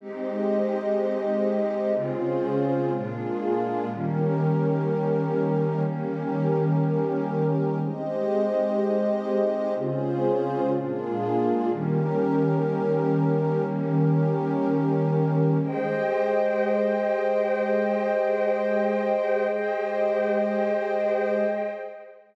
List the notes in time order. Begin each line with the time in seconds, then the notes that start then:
0.01 G#3 C4 D#4 G4 C5 D#5
1.94 C#3 G#3 C4 C#4 F4 G#4 C5
2.93 A#2 G#3 A#3 D4 F4 G#4
3.89 D#3 G3 A#3 C#4 G4 A#4
5.85 D#3 G3 A#3 C#4 G4 A#4
7.80 G#3 C4 D#4 G4 C5 D#5
9.75 C#3 G#3 C4 C#4 F4 G#4 C5
10.73 A#2 G#3 A#3 D4 F4 G#4
11.71 D#3 G3 A#3 C#4 G4 A#4
13.65 D#3 G3 A#3 C#4 G4 A#4
15.61 G#3 G4 G#4 C5 D#5 G5
19.51 G#3 G4 G#4 C5 D#5 G5